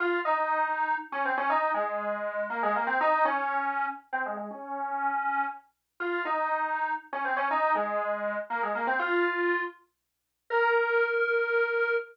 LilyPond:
\new Staff { \time 3/4 \key bes \minor \tempo 4 = 120 f'8 ees'4. r16 des'16 c'16 des'16 | ees'8 aes4. bes16 aes16 bes16 c'16 | ees'8 des'4. r16 c'16 aes16 aes16 | des'2 r4 |
f'8 ees'4. r16 des'16 c'16 des'16 | ees'8 aes4. bes16 aes16 bes16 c'16 | f'4. r4. | bes'2. | }